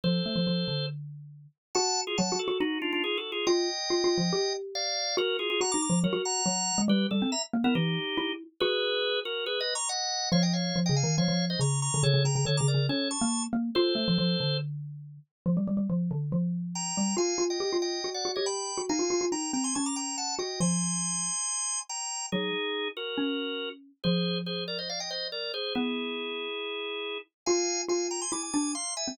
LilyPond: <<
  \new Staff \with { instrumentName = "Drawbar Organ" } { \time 4/4 \key ees \major \tempo 4 = 140 <a' c''>2 r2 | <ges'' a''>8. <f' aes'>16 <ges'' a''>8 <ges' a'>8 <ees' ges'>8 <d' f'>16 <d' f'>16 \tuplet 3/2 { <f' aes'>8 <ges' a'>8 <f' aes'>8 } | <ees'' g''>2. <d'' f''>4 | <ges' bes'>8 <f' aes'>16 <f' aes'>16 <ges'' bes''>16 <bes'' d'''>16 <bes'' d'''>8 <ges' bes'>8 <ges'' bes''>4. |
<g' b'>8 a'8 <e'' bes''>16 r8 <e' bes'>16 <ees' g'>4. r8 | <aes' ces''>4. <ges' bes'>8 \tuplet 3/2 { <aes' ces''>8 <ces'' ees''>8 <bes'' des'''>8 } <ees'' ges''>4 | <des'' f''>16 <ees'' g''>16 <des'' f''>8. <ees'' g''>16 <f'' aes''>8 <des'' f''>8. <c'' ees''>16 <bes'' des'''>8 <bes'' des'''>8 | <a' cis''>8 <g'' bes''>16 <g'' bes''>16 <a' cis''>16 <bes'' d'''>16 <bes' d''>8 <a' cis''>8 <a'' cis'''>8. r8. |
<a' c''>2 r2 | \key c \minor r2. <g'' bes''>4 | <f'' aes''>8. <ees'' g''>8. <ees'' g''>8. <d'' fis''>8 <cis'' ees''>16 <g'' b''>4 | <f'' aes''>4 <g'' bes''>8 <g'' bes''>16 <aes'' c'''>16 <a'' cis'''>16 <bes'' d'''>16 <g'' bes''>8 <fis'' a''>8 <ees'' g''>8 |
<aes'' c'''>2. <g'' bes''>4 | <ees' gis'>4. <fis' bes'>2 r8 | <aes' c''>4 <aes' c''>8 <bes' d''>16 <c'' ees''>16 <d'' f''>16 <ees'' g''>16 <c'' ees''>8 <bes' d''>8 <aes' c''>8 | <e' gis'>1 |
<f'' aes''>4 <f'' aes''>8 <g'' bes''>16 <aes'' c'''>16 <gis'' d'''>16 <gis'' d'''>16 <gis'' d'''>8 <f'' bis''>8 <e'' gis''>8 | }
  \new Staff \with { instrumentName = "Xylophone" } { \time 4/4 \key ees \major f8 a16 f16 f8 d2 r8 | ges'4 \tuplet 3/2 { ges8 ges'8 ges'8 } ees'2 | f'8 r8 \tuplet 3/2 { f'8 f'8 f8 } g'2 | ges'4 \tuplet 3/2 { ges'8 ees'8 f8 } ges16 ges'8. ges8. aes16 |
g8 g16 c'16 r8 bes16 b16 e8 r8 e'8. r16 | ges'2. r4 | f4 \tuplet 3/2 { f8 des8 ees8 } f16 f8. des8. d16 | cis16 cis16 cis16 cis16 \tuplet 3/2 { d8 cis8 cis8 } cis'8. bes8. bes8 |
f'8 a16 f16 f8 d2 r8 | \key c \minor f16 g16 g16 g16 f8 d8 f4. g8 | f'8 f'8 g'16 f'8. fis'8 fis'16 g'4 fis'16 | ees'16 f'16 f'16 f'16 ees'8 c'8 cis'4. fis'8 |
f2 r2 | fis8 r4. cis'2 | f1 | b2 r2 |
f'4 f'4 e'8 d'8 r8. bis16 | }
>>